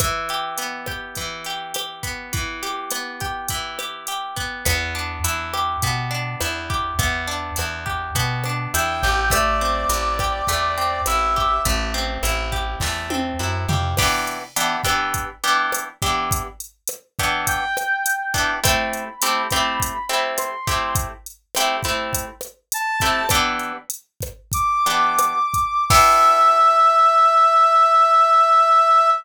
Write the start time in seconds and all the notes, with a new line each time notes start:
0.00 E3, kick, cross-stick, closed hi-hat
0.29 G4, closed hi-hat
0.58 B3, closed hi-hat
0.86 G4, kick, cross-stick
1.15 E3, kick, closed hi-hat
1.45 G4, closed hi-hat
1.74 G4, cross-stick, closed hi-hat
2.03 B3, kick, closed hi-hat
2.33 E3, kick, closed hi-hat
2.63 G4, closed hi-hat
2.91 B3, cross-stick, closed hi-hat
3.20 G4, kick, closed hi-hat
3.48 E3, kick, closed hi-hat
3.79 G4, cross-stick, closed hi-hat
4.07 G4, closed hi-hat
4.36 B3, kick, closed hi-hat
4.65 E2 B3, kick, cross-stick, closed hi-hat
4.95 D4
5.24 E2 E4, closed hi-hat
5.54 G4, cross-stick
5.82 B2 B3, kick, closed hi-hat
6.11 D4
6.41 E2 E4, cross-stick, closed hi-hat
6.70 G4, kick
6.99 E2 B3, kick, closed hi-hat
7.27 D4
7.56 E2 E4, cross-stick, closed hi-hat
7.86 G4, kick
8.15 B2 B3, kick, closed hi-hat
8.44 D4, cross-stick
8.74 E2 E4 G5, closed hi-hat
9.03 A1 G4, kick
9.30 A3 D5, kick, cross-stick, closed hi-hat
9.61 C4
9.89 A1 E4, closed hi-hat
10.19 G4, kick, cross-stick
10.47 E2 A3, kick, closed hi-hat
10.78 C4
11.06 A1 E4 E5, cross-stick, closed hi-hat
11.36 G4, kick
11.65 A1 A3, kick, closed hi-hat
11.94 C4
12.23 A1 E4, cross-stick, closed hi-hat
12.52 G4, kick
12.80 E2 A3, kick, snare
13.10 C4, high tom
13.39 F#2 E4
13.69 F2 G4, floor tom
13.97 E3 B3 D4 G4, kick, cross-stick, crash
14.27 closed hi-hat
14.56 E3 B3 D4 G4, closed hi-hat
14.84 E3 B3 D4 G4, kick, cross-stick, closed hi-hat
15.14 kick, closed hi-hat
15.44 E3 B3 D4 G4, closed hi-hat
15.72 cross-stick, closed hi-hat
16.02 E3 B3 D4 G4, kick, closed hi-hat
16.31 kick, closed hi-hat
16.60 closed hi-hat
16.87 cross-stick, closed hi-hat
17.19 E3 B3 D4 G4, kick, closed hi-hat
17.47 G5, kick, closed hi-hat
17.77 cross-stick, closed hi-hat
18.06 closed hi-hat
18.34 E3 B3 D4 G4, kick, closed hi-hat
18.64 A3 C4 E4 G4 B5, kick, cross-stick, closed hi-hat
18.93 closed hi-hat
19.22 A3 C4 E4 G4, closed hi-hat
19.50 A3 C4 E4 G4, kick, cross-stick, closed hi-hat
19.80 kick, closed hi-hat
20.09 A3 C4 E4 G4, closed hi-hat
20.38 C6, cross-stick, closed hi-hat
20.67 A3 C4 E4 G4, kick, closed hi-hat
20.95 kick, closed hi-hat
21.26 closed hi-hat
21.55 A3 C4 E4 G4, cross-stick, closed hi-hat
21.83 A3 C4 E4 G4, kick, closed hi-hat
22.13 kick, closed hi-hat
22.41 cross-stick, closed hi-hat
22.72 A5, closed hi-hat
23.00 A3 C4 E4 G4, kick, closed hi-hat
23.29 E3 B3 D4 G4, kick, cross-stick, closed hi-hat
23.59 closed hi-hat
23.90 closed hi-hat
24.21 kick, cross-stick, closed hi-hat
24.52 D6, kick, closed hi-hat
24.86 E3 B3 D4 G4, closed hi-hat
25.19 cross-stick, closed hi-hat
25.54 kick, closed hi-hat
25.90 B3 D4 E4 G4 E5, kick, crash